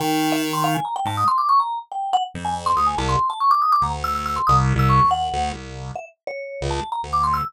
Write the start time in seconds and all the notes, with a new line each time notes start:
0.00 D#3 G5
0.32 E5
0.53 C6
0.64 F5
0.75 G#5
0.85 A#5
0.96 G5
1.05 G#2 A5
1.17 D#6
1.28 C6
1.38 D6
1.49 C#6
1.60 A#5
1.92 G5
2.13 F#5
2.34 F2
2.45 G#5
2.66 C6
2.76 D2 D#6
2.87 G#5
2.97 C2 A5
3.09 C6
3.30 A5
3.40 C#6
3.51 D6
3.62 D#6
3.72 D6
3.81 D2 A#5
4.04 E6
4.15 E6
4.26 E6
4.36 C6
4.47 C2 D#6
4.75 C2 E6
4.89 C#6
5.04 D#2
5.11 F#5
5.33 D2
5.53 C2
5.95 E5
6.27 C#5
6.61 C#2
6.71 A5
6.92 A#5
7.03 D2
7.13 D6
7.24 C6
7.34 E6